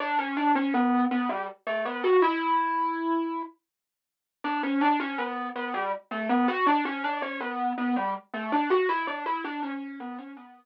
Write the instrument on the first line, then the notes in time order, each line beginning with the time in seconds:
marimba
0.00 D4
0.19 C#4
0.37 D4
0.55 C#4
0.74 B3
1.11 B3
1.29 G3
1.67 A3
1.85 B3
2.04 F#4
2.22 E4
4.44 D4
4.63 C#4
4.81 D4
5.00 C#4
5.18 B3
5.56 B3
5.74 G3
6.11 A3
6.29 B3
6.48 F#4
6.67 D4
6.85 C#4
7.04 D4
7.22 C#4
7.41 B3
7.78 B3
7.96 G3
8.34 A3
8.52 D4
8.70 F#4
8.89 E4
9.07 D4
9.26 E4
9.44 D4
9.63 C#4
10.00 B3
10.19 C#4
10.37 B3